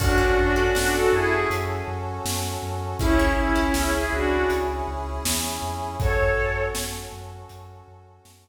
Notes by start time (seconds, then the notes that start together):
0.00 F#2 C#4 D4 F#4 A4, kick, crash
0.18 C#4 F#4 A4
0.38 F#2 D4 F#4
0.56 C#4 F#4 A4
0.75 F#2 C#4 D4 F#4 A4, snare
0.94 F#4 A4
1.12 F#2 E4 G#4
1.50 F#2, closed hi-hat
1.88 F#2
2.25 F#2, snare
2.63 F#2
2.99 C#2 C#4 E4 G#4, kick, closed hi-hat
3.19 C#4 E4 G#4
3.38 C#2 C#4 E4
3.55 C#4 E4 G#4
3.74 C#2 C#4 E4 G#4, snare
3.94 E4 G#4
4.12 C#2 D4 F#4
4.50 C#2, closed hi-hat
4.88 C#2
5.25 E2, snare
5.62 F2
6.00 F#2 C#4 F#4 A4 C#5, kick, closed hi-hat
6.38 F#2
6.75 F#2, snare
7.12 F#2
7.49 F#2, closed hi-hat
7.88 F#2
8.25 F#2, snare